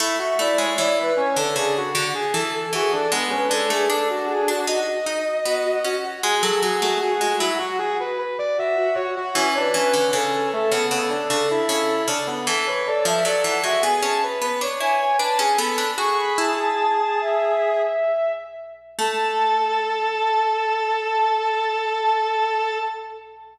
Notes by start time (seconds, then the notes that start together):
0.00 A3 E4
0.19 F#4 E5
0.39 A3 E4 D5
0.58 G#3 C#5
0.78 E3 E4 D5
0.97 B4
1.17 C#4 C#5
1.36 D3 D4 A4
1.56 C#3 D4 G#4
1.77 F#4
1.94 D3 F#4
2.15 G#4
2.33 E3 A4
2.53 A4
2.73 E3 F#4 G#4
2.92 D4 A4
3.12 G#3 B3
3.30 C#4 B4
3.48 G#3 D4 A4
3.70 A3 G#4
3.90 D4 A4
4.09 F#4
4.29 G#4
4.48 D4 F#4
4.67 D#4 F#4 D#5
5.06 D#4
5.45 B3 F#4
5.65 F#4
5.84 C#4 F#4
6.04 F#4
6.23 G#3 G#4
6.42 F#3 G#4 A4
6.63 F#3 F#4 G#4
6.82 A3 F#4
7.01 F#4 G#4
7.21 G#3 F#4
7.39 F#3 E4 F#4
7.58 F#4
7.79 F#4 G#4
8.00 B4
8.19 B4
8.39 D5
8.57 F#4 E5
8.77 F#4
8.95 F#4 C#5
9.16 F#4
9.35 E3 C#4 C#5
9.54 D4 B4
9.74 E3 C#4
9.94 D3
10.11 C#3 C#4 A4
10.33 A4
10.52 A3 A4
10.71 C#3 B3 A4
10.91 C#3 B3
11.09 D4
11.30 C#3 D4
11.51 E4
11.69 C#3 E4
12.08 C#3 D4
12.27 B3
12.47 E3 A4
12.66 B4 C#5
12.86 A4 D5
13.05 F3 E5
13.25 F#3 A4 D5
13.44 E3 F#5
13.63 G#3 F#4 E5
13.82 B3 G#4 G#5
14.02 C#4 G#4 A5
14.24 B4
14.42 B3 B4
14.61 D4 C#5
14.81 E4 C#5 G#5
15.00 G#5
15.18 D4 B4 A5
15.39 C#4 G#4 G#5
15.57 B3 A4 B5
15.78 D4
15.97 F#4 G#4 C#6
16.18 B5
16.38 E4 A5
16.58 A5
17.21 E5
18.99 A3 A4 A5